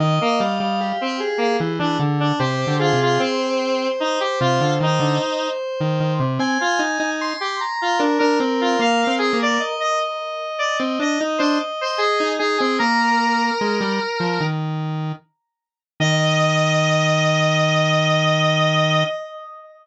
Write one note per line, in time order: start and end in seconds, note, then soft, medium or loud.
0.00 0.19 D#3 loud
0.00 0.36 D#5 medium
0.21 0.40 A#3 medium
0.40 0.59 G3 medium
0.40 0.80 F5 medium
0.60 0.93 G3 medium
0.81 1.17 G4 medium
1.01 1.20 C4 medium
1.20 1.57 G#4 medium
1.38 1.57 A#3 medium
1.60 1.79 E3 medium
1.79 1.99 E3 medium
1.79 1.98 D4 medium
1.99 2.32 D3 medium
2.20 2.39 D4 medium
2.39 2.65 C3 medium
2.39 2.77 G4 medium
2.39 2.75 C5 medium
2.67 2.92 D3 medium
2.79 2.99 F4 medium
2.79 3.18 G#4 medium
2.93 3.19 C3 medium
3.02 3.21 F4 medium
3.19 3.88 C4 medium
3.19 6.13 C5 medium
4.00 4.19 D#4 medium
4.20 4.39 G4 medium
4.41 4.60 C3 medium
4.41 4.73 F4 medium
4.61 4.79 D3 medium
4.81 5.00 D#3 medium
4.81 5.48 D#4 medium
5.00 5.19 D3 medium
5.81 6.00 D#3 medium
6.00 6.19 D#3 medium
6.20 6.39 C3 medium
6.39 6.58 C4 loud
6.39 7.10 G#5 loud
6.61 6.80 F4 medium
6.79 6.98 D#4 medium
7.00 7.33 D#4 medium
7.21 7.56 C6 medium
7.40 7.59 G4 medium
7.61 7.98 A#5 medium
7.82 8.01 F4 medium
7.99 8.19 D4 medium
7.99 9.07 A#4 medium
8.19 8.39 D4 medium
8.19 8.38 A#4 medium
8.40 8.77 C4 medium
8.61 8.80 F4 medium
8.79 9.05 A#3 medium
8.79 9.14 F5 medium
9.07 9.32 C4 medium
9.18 9.37 G#4 medium
9.33 9.58 A#3 medium
9.40 9.59 A#4 medium
9.40 9.61 D5 medium
9.60 12.31 D#5 medium
9.80 9.99 D#5 medium
10.59 10.78 D5 medium
10.79 10.99 C4 medium
10.99 11.18 D4 medium
10.99 11.20 D#5 medium
11.21 11.40 D#4 medium
11.38 11.59 D4 loud
11.38 11.57 C5 medium
11.81 12.00 C5 medium
11.98 12.32 G#4 medium
12.20 12.39 D#4 medium
12.39 12.59 D#4 medium
12.39 12.57 G#4 medium
12.58 12.79 C4 medium
12.58 12.77 G#4 medium
12.79 13.51 A#3 medium
12.79 14.46 A#4 medium
12.79 13.45 A#5 medium
13.61 13.80 G#3 medium
13.81 14.00 G3 medium
14.20 14.39 F3 medium
14.40 15.12 D#3 medium
16.00 19.04 D#3 loud
16.00 19.04 D#5 loud
16.00 19.05 D#5 loud